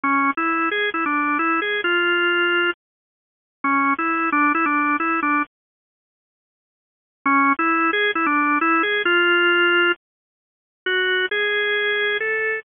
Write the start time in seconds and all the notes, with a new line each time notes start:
0.03 C#4
0.37 E4
0.71 G#4
0.94 E4
1.06 D4
1.39 E4
1.62 G#4
1.84 F4
3.64 C#4
3.98 E4
4.32 D4
4.55 E4
4.66 D4
5.00 E4
5.22 D4
7.26 C#4
7.59 E4
7.93 G#4
8.15 E4
8.26 D4
8.61 E4
8.83 G#4
9.05 F4
10.86 F#4
11.31 G#4
12.20 A4